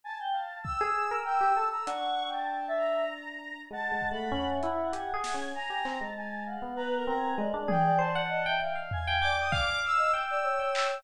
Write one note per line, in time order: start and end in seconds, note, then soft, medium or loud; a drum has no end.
0.04 0.18 G#5 medium
0.04 0.18 A5 medium
0.20 0.33 G5 medium
0.32 0.60 F5 medium
0.32 0.59 A5 medium
0.63 1.18 E6 medium
0.63 kick medium
0.81 1.08 G#4 loud
1.11 1.39 A#4 medium
1.25 1.52 G5 medium
1.25 1.67 E6 medium
1.41 1.55 G4 medium
1.56 1.84 A4 medium
1.56 1.70 A5 medium
1.70 1.86 A#5 medium
1.70 1.84 E6 medium
1.86 3.52 D4 medium
1.86 2.23 F#5 loud
1.86 2.28 C#6 medium
1.86 closed hi-hat medium
2.28 2.65 G5 medium
2.33 2.74 A5 medium
2.68 3.04 E5 loud
2.77 3.60 A#5 soft
3.71 3.89 G#3 medium
3.71 5.37 F#5 medium
3.71 4.09 A5 loud
3.92 4.10 G#3 medium
4.01 kick medium
4.11 4.30 A3 medium
4.11 4.48 B5 medium
4.32 4.59 C#4 loud
4.32 floor tom medium
4.50 4.87 E5 medium
4.63 4.91 E4 medium
4.63 closed hi-hat soft
4.92 5.11 G4 medium
4.92 5.48 G#5 medium
4.92 closed hi-hat medium
5.14 5.32 G#4 loud
5.24 snare medium
5.34 5.53 C#4 medium
5.55 5.82 G#5 medium
5.55 5.96 A#5 medium
5.70 5.84 G4 medium
5.85 5.99 C4 medium
5.85 6.13 A#5 medium
5.85 clap medium
6.01 6.56 G#3 medium
6.01 6.42 A5 medium
6.17 6.45 G#5 medium
6.46 6.74 F5 soft
6.46 6.76 F#5 medium
6.62 7.03 B3 medium
6.75 6.94 B4 loud
6.75 7.04 A#5 medium
6.96 7.14 A#4 medium
7.07 7.35 C4 medium
7.07 7.36 A#5 loud
7.16 7.35 G#4 soft
7.38 7.52 G#3 loud
7.38 8.22 D5 loud
7.54 7.67 D4 loud
7.68 7.96 G#4 medium
7.68 7.98 G5 loud
7.68 high tom loud
7.98 8.12 C5 loud
7.98 8.55 A5 medium
8.15 8.43 F#5 loud
8.28 8.42 D#5 loud
8.46 8.73 E5 medium
8.46 8.60 G5 loud
8.60 9.18 F5 medium
8.60 8.74 G5 medium
8.75 9.03 F5 medium
8.91 9.20 G#5 loud
8.91 floor tom loud
9.07 9.21 G5 loud
9.21 9.78 D5 medium
9.21 9.49 G5 medium
9.21 9.35 D6 medium
9.39 9.53 D#6 medium
9.52 10.07 F5 loud
9.52 9.79 D6 loud
9.52 kick loud
9.85 10.12 E6 loud
9.97 10.11 D#5 medium
10.13 10.55 G5 medium
10.13 10.26 E6 medium
10.13 cowbell medium
10.28 10.44 D5 loud
10.28 10.97 E6 medium
10.44 10.99 C#5 medium
10.59 11.01 G5 medium
10.75 clap loud